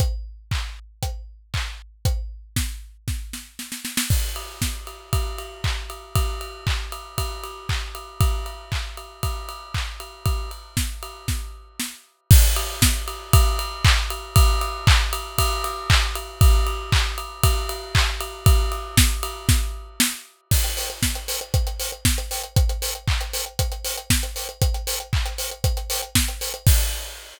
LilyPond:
\new DrumStaff \drummode { \time 4/4 \tempo 4 = 117 <hh bd>4 <hc bd>4 <hh bd>4 <hc bd>4 | <hh bd>4 <bd sn>4 <bd sn>8 sn8 sn16 sn16 sn16 sn16 | <cymc bd>8 cymr8 <bd sn>8 cymr8 <bd cymr>8 cymr8 <hc bd>8 cymr8 | <bd cymr>8 cymr8 <hc bd>8 cymr8 <bd cymr>8 cymr8 <hc bd>8 cymr8 |
<bd cymr>8 cymr8 <hc bd>8 cymr8 <bd cymr>8 cymr8 <hc bd>8 cymr8 | <bd cymr>8 cymr8 <bd sn>8 cymr8 <bd sn>4 sn4 | <cymc bd>8 cymr8 <bd sn>8 cymr8 <bd cymr>8 cymr8 <hc bd>8 cymr8 | <bd cymr>8 cymr8 <hc bd>8 cymr8 <bd cymr>8 cymr8 <hc bd>8 cymr8 |
<bd cymr>8 cymr8 <hc bd>8 cymr8 <bd cymr>8 cymr8 <hc bd>8 cymr8 | <bd cymr>8 cymr8 <bd sn>8 cymr8 <bd sn>4 sn4 | <cymc bd>16 hh16 hho16 hh16 <bd sn>16 hh16 hho16 hh16 <hh bd>16 hh16 hho16 hh16 <bd sn>16 hh16 hho16 hh16 | <hh bd>16 hh16 hho16 hh16 <hc bd>16 hh16 hho16 hh16 <hh bd>16 hh16 hho16 hh16 <bd sn>16 hh16 hho16 hh16 |
<hh bd>16 hh16 hho16 hh16 <hc bd>16 hh16 hho16 hh16 <hh bd>16 hh16 hho16 hh16 <bd sn>16 hh16 hho16 hh16 | <cymc bd>4 r4 r4 r4 | }